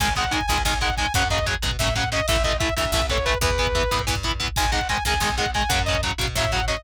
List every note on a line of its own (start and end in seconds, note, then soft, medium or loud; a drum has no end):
0.00 0.42 G#1 loud
0.00 0.07 D#3 loud
0.00 0.07 G#3 loud
0.00 0.14 G#5 medium
0.00 kick medium
0.00 closed hi-hat medium
0.08 kick medium
0.16 0.23 D#3 loud
0.16 0.23 G#3 loud
0.16 0.32 F#5 medium
0.16 kick medium
0.16 closed hi-hat medium
0.24 kick medium
0.31 0.38 D#3 loud
0.31 0.38 G#3 loud
0.31 0.47 G#5 medium
0.31 kick medium
0.31 closed hi-hat medium
0.41 kick medium
0.47 0.64 C#2 loud
0.47 0.56 D#3 loud
0.47 0.56 G#3 loud
0.47 0.62 G#5 medium
0.47 kick medium
0.47 closed hi-hat medium
0.58 kick medium
0.65 1.07 B1 loud
0.65 0.72 D#3 loud
0.65 0.72 G#3 medium
0.65 0.78 G#5 medium
0.65 kick medium
0.65 snare medium
0.73 kick medium
0.81 0.88 D#3 medium
0.81 0.88 G#3 loud
0.81 0.95 F#5 medium
0.81 kick medium
0.81 closed hi-hat medium
0.90 kick medium
0.97 1.05 D#3 medium
0.97 1.05 G#3 loud
0.97 1.13 G#5 medium
0.97 kick medium
0.97 closed hi-hat medium
1.06 kick medium
1.14 1.56 F#2 loud
1.14 1.22 C#3 loud
1.14 1.22 F#3 loud
1.14 1.28 F#5 medium
1.14 kick medium
1.14 closed hi-hat loud
1.22 kick medium
1.30 1.37 C#3 loud
1.30 1.37 F#3 medium
1.30 1.46 D#5 medium
1.30 kick medium
1.30 closed hi-hat medium
1.39 kick medium
1.46 1.53 C#3 loud
1.46 1.53 F#3 loud
1.46 kick medium
1.46 closed hi-hat medium
1.54 kick medium
1.62 1.77 B2 medium
1.62 1.69 C#3 medium
1.62 1.69 F#3 loud
1.62 kick medium
1.62 closed hi-hat medium
1.71 kick medium
1.79 2.21 A2 loud
1.79 1.87 C#3 loud
1.79 1.87 F#3 loud
1.79 1.94 E5 medium
1.79 kick medium
1.79 snare medium
1.87 kick medium
1.96 2.02 C#3 medium
1.96 2.02 F#3 loud
1.96 2.09 F#5 medium
1.96 kick medium
1.96 closed hi-hat medium
2.04 kick medium
2.12 2.18 C#3 loud
2.12 2.18 F#3 medium
2.12 2.26 D#5 medium
2.12 kick medium
2.12 closed hi-hat medium
2.20 kick medium
2.28 2.70 A1 loud
2.28 2.35 E3 loud
2.28 2.35 A3 loud
2.28 2.43 E5 medium
2.28 kick medium
2.28 closed hi-hat loud
2.36 kick medium
2.43 2.51 E3 loud
2.43 2.51 A3 loud
2.43 2.57 D#5 medium
2.43 kick medium
2.43 closed hi-hat medium
2.52 kick medium
2.59 2.67 E3 loud
2.59 2.67 A3 medium
2.59 2.74 E5 medium
2.59 kick medium
2.59 closed hi-hat medium
2.69 kick medium
2.77 2.92 D2 medium
2.77 2.83 E3 loud
2.77 2.83 A3 medium
2.77 2.91 E5 medium
2.77 kick medium
2.77 closed hi-hat medium
2.85 kick medium
2.92 3.34 C2 loud
2.92 2.99 E3 medium
2.92 2.99 A3 medium
2.92 3.06 E5 medium
2.92 kick medium
2.92 snare medium
3.02 kick medium
3.09 3.16 E3 medium
3.09 3.16 A3 medium
3.09 3.25 C#5 medium
3.09 kick medium
3.09 closed hi-hat medium
3.18 kick medium
3.25 3.32 E3 medium
3.25 3.32 A3 loud
3.25 3.38 B4 medium
3.25 kick medium
3.25 closed hi-hat medium
3.34 kick medium
3.41 3.83 E2 loud
3.41 3.48 E3 loud
3.41 3.48 B3 loud
3.41 4.02 B4 medium
3.41 kick medium
3.41 closed hi-hat medium
3.50 kick medium
3.58 3.65 E3 medium
3.58 3.65 B3 loud
3.58 kick medium
3.58 closed hi-hat medium
3.67 kick medium
3.75 3.81 E3 loud
3.75 3.81 B3 medium
3.75 kick medium
3.75 closed hi-hat medium
3.83 kick medium
3.91 4.06 A2 medium
3.91 3.98 E3 loud
3.91 3.98 B3 loud
3.91 kick medium
3.91 closed hi-hat medium
3.99 kick medium
4.07 4.50 G2 loud
4.07 4.13 E3 loud
4.07 4.13 B3 medium
4.07 kick medium
4.07 snare medium
4.15 kick medium
4.23 4.31 E3 medium
4.23 4.31 B3 medium
4.23 kick medium
4.23 closed hi-hat medium
4.32 kick medium
4.40 4.46 E3 loud
4.40 4.46 B3 loud
4.40 kick medium
4.40 closed hi-hat medium
4.48 kick medium
4.56 4.99 G#1 loud
4.56 4.64 D#3 loud
4.56 4.64 G#3 loud
4.56 4.71 G#5 medium
4.56 kick medium
4.56 closed hi-hat medium
4.65 kick medium
4.72 4.79 D#3 loud
4.72 4.79 G#3 loud
4.72 4.88 F#5 medium
4.72 kick medium
4.72 closed hi-hat medium
4.81 kick medium
4.89 4.96 D#3 loud
4.89 4.96 G#3 loud
4.89 5.04 G#5 medium
4.89 kick medium
4.89 closed hi-hat medium
4.97 kick medium
5.05 5.19 C#2 loud
5.05 5.13 D#3 loud
5.05 5.13 G#3 loud
5.05 5.21 G#5 medium
5.05 kick medium
5.05 closed hi-hat medium
5.14 kick medium
5.20 5.62 B1 loud
5.20 5.27 D#3 loud
5.20 5.27 G#3 medium
5.20 5.35 G#5 medium
5.20 kick medium
5.20 snare medium
5.29 kick medium
5.38 5.44 D#3 medium
5.38 5.44 G#3 loud
5.38 5.51 F#5 medium
5.38 kick medium
5.38 closed hi-hat medium
5.46 kick medium
5.54 5.61 D#3 medium
5.54 5.61 G#3 loud
5.54 5.71 G#5 medium
5.54 kick medium
5.54 closed hi-hat medium
5.62 kick medium
5.69 6.11 F#2 loud
5.69 5.77 C#3 loud
5.69 5.77 F#3 loud
5.69 5.82 F#5 medium
5.69 kick medium
5.69 closed hi-hat loud
5.79 kick medium
5.85 5.95 C#3 loud
5.85 5.95 F#3 medium
5.85 6.01 D#5 medium
5.85 kick medium
5.85 closed hi-hat medium
5.95 kick medium
6.03 6.10 C#3 loud
6.03 6.10 F#3 loud
6.03 kick medium
6.03 closed hi-hat medium
6.11 kick medium
6.18 6.35 B2 medium
6.18 6.25 C#3 medium
6.18 6.25 F#3 loud
6.18 kick medium
6.18 closed hi-hat medium
6.28 kick medium
6.35 6.77 A2 loud
6.35 6.43 C#3 loud
6.35 6.43 F#3 loud
6.35 6.51 E5 medium
6.35 kick medium
6.35 snare medium
6.45 kick medium
6.52 6.59 C#3 medium
6.52 6.59 F#3 loud
6.52 6.65 F#5 medium
6.52 kick medium
6.52 closed hi-hat medium
6.60 kick medium
6.68 6.74 C#3 loud
6.68 6.74 F#3 medium
6.68 6.82 D#5 medium
6.68 kick medium
6.68 closed hi-hat medium
6.77 kick medium